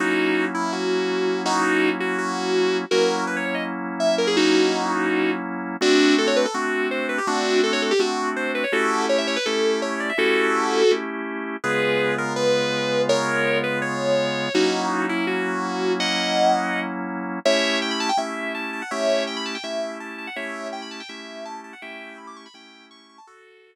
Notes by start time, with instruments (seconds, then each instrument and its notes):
0.00 drawbar organ F#3 A#3 C#4 E4, distortion guitar D#4 F#4
0.54 distortion guitar E4
0.72 distortion guitar F#4
1.46 distortion guitar D#4 F#4
2.00 distortion guitar F#4
2.18 distortion guitar F#4
2.91 drawbar organ F#3 A#3 C#4 E4, distortion guitar F#4 A#4
3.27 distortion guitar B4
3.36 distortion guitar C#5
3.46 distortion guitar C#5
3.55 distortion guitar D#5
4.00 distortion guitar E5
4.18 distortion guitar A#4
4.27 distortion guitar G#4
4.37 distortion guitar D#4 F#4
5.81 drawbar organ A3 C4 D4 F#4, distortion guitar D4 F#4
6.18 distortion guitar A4
6.27 distortion guitar C#5
6.36 distortion guitar B4
6.45 distortion guitar A4
6.54 drawbar organ A3 C4 D4 F#4, distortion guitar F#4
6.91 distortion guitar C5
7.09 distortion guitar B4
7.18 distortion guitar G4
7.27 drawbar organ A3 C4 D4 F#4, distortion guitar D4 F#4
7.63 distortion guitar A4
7.73 distortion guitar C#5
7.82 distortion guitar A4
7.91 distortion guitar G4
7.99 drawbar organ A3 C4 D4 F#4, distortion guitar F#4
8.36 distortion guitar C5
8.55 distortion guitar B4
8.64 distortion guitar C#5
8.72 drawbar organ A3 C#4 E4 G4, distortion guitar F#4 A4
9.09 distortion guitar C#5
9.18 distortion guitar E5
9.27 distortion guitar C#5
9.36 distortion guitar B4
9.46 drawbar organ A3 C#4 E4 G4, distortion guitar A4
9.82 distortion guitar C#5
10.00 distortion guitar D5
10.09 distortion guitar E5
10.18 drawbar organ A3 C#4 E4 G4, distortion guitar F#4 A4
10.91 drawbar organ A3 C#4 E4 G4
11.64 drawbar organ C#3 G#3 B3 F4, distortion guitar G#4 B4
12.18 distortion guitar A#4
12.36 distortion guitar B4
13.09 distortion guitar A#4 C#5
13.64 distortion guitar B4
13.82 distortion guitar C#5
14.54 drawbar organ F#3 A#3 C#4 E4, distortion guitar D#4 F#4
15.09 distortion guitar E4
15.27 distortion guitar F#4
16.00 distortion guitar D#5 F#5
17.45 drawbar organ A3 C#4 E4 G4, distortion guitar C#5 E5
17.82 distortion guitar G5
17.91 distortion guitar B5
18.00 distortion guitar A5
18.09 distortion guitar G5
18.17 drawbar organ A3 C#4 E4 G4, distortion guitar E5
18.55 distortion guitar A5
18.73 distortion guitar A5
18.82 distortion guitar F#5
18.91 drawbar organ A3 C#4 E4 G4, distortion guitar C#5 E5
19.27 distortion guitar G5
19.37 distortion guitar B5
19.46 distortion guitar A5
19.55 distortion guitar G5
19.63 drawbar organ A3 C#4 E4 G4, distortion guitar E5
20.00 distortion guitar A5
20.18 distortion guitar A5
20.27 distortion guitar F#5
20.36 drawbar organ A3 C#4 E4 G4, distortion guitar C#5 E5
20.73 distortion guitar G5
20.82 distortion guitar B5
20.91 distortion guitar A5
21.00 distortion guitar G5
21.09 drawbar organ A3 C#4 E4 G4, distortion guitar E5
21.45 distortion guitar A5
21.64 distortion guitar A5
21.73 distortion guitar F#5
21.82 drawbar organ A3 C#4 E4 G4, distortion guitar E5 G5
22.18 distortion guitar B5
22.27 distortion guitar D6
22.36 distortion guitar C#6
22.46 distortion guitar B5
22.54 drawbar organ A3 C#4 E4 G4, distortion guitar G5
22.91 distortion guitar C#6
23.09 distortion guitar C#6
23.18 distortion guitar A5
23.27 distortion guitar F#4 A4